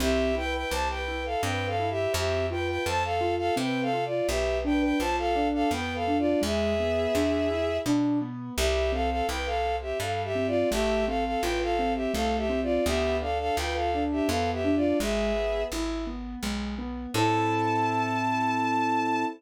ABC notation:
X:1
M:3/4
L:1/16
Q:1/4=84
K:Am
V:1 name="Violin"
[Ge]2 [Bg] [Bg] [ca] [Bg]2 [Af] (3[Bg]2 [Af]2 [Ge]2 | [Ge]2 [Bg] [Bg] [ca] [Af]2 [Af] (3[Bg]2 [Af]2 [Fd]2 | [Ge]2 [Bg] [Bg] [ca] [Af]2 [Af] (3[Bg]2 [Af]2 [Fd]2 | [^Ge]8 z4 |
[Ge]2 [Af] [Af] [Bg] [Af]2 [Ge] (3[Af]2 [Ge]2 [Fd]2 | [Ge]2 [Af] [Af] [Bg] [Af]2 [Ge] (3[Af]2 [Ge]2 [Fd]2 | [Ge]2 [Af] [Af] [Bg] [Af]2 [Ge] (3[Af]2 [Ge]2 [Fd]2 | [^Ge]4 z8 |
a12 |]
V:2 name="Acoustic Grand Piano"
C2 E2 G2 E2 C2 E2 | C2 F2 A2 F2 C2 F2 | B,2 D2 F2 D2 B,2 D2 | ^G,2 B,2 D2 E2 D2 B,2 |
G,2 C2 E2 C2 G,2 C2 | A,2 C2 F2 C2 A,2 C2 | B,2 D2 F2 D2 B,2 D2 | ^G,2 B,2 E2 B,2 G,2 B,2 |
[CEA]12 |]
V:3 name="Electric Bass (finger)" clef=bass
C,,4 C,,4 G,,4 | F,,4 F,,4 C,4 | B,,,4 B,,,4 F,,4 | E,,4 E,,4 B,,4 |
C,,4 C,,4 G,,4 | A,,,4 A,,,4 C,,4 | D,,4 D,,4 F,,4 | ^G,,,4 G,,,4 B,,,4 |
A,,12 |]